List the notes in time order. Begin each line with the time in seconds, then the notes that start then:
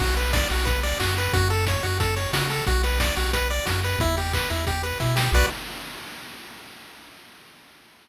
0.00 B1 F#4, kick, crash
0.17 B4, open hi-hat
0.33 D5, kick, snare
0.50 B1 F#4, open hi-hat
0.65 B4, kick, closed hi-hat
0.83 D5, open hi-hat
1.00 F#2 F#4, kick, clap
1.17 B4, open hi-hat
1.33 F#2 F#4, kick, closed hi-hat
1.50 A4, open hi-hat
1.67 C#5, kick, snare
1.83 F#2 F#4, open hi-hat
2.00 A4, kick, closed hi-hat
2.16 C#5, open hi-hat
2.33 C#3 F#4, kick, snare
2.50 A4, open hi-hat
2.67 B1 F#4, kick, closed hi-hat
2.83 B4, open hi-hat
3.00 D5, kick, snare
3.16 B1 F#4, open hi-hat
3.33 B4, kick, closed hi-hat
3.50 D5, open hi-hat
3.65 F#2 F#4, kick, snare
3.83 B4, open hi-hat
3.99 E2 E4, kick, closed hi-hat
4.17 G4, open hi-hat
4.33 B4, kick, clap
4.50 E2 E4, open hi-hat
4.67 G4, kick, closed hi-hat
4.83 B4, open hi-hat
5.00 B2 E4, kick, snare
5.16 G4, snare
5.32 B1 F#4 B4 D5, kick, crash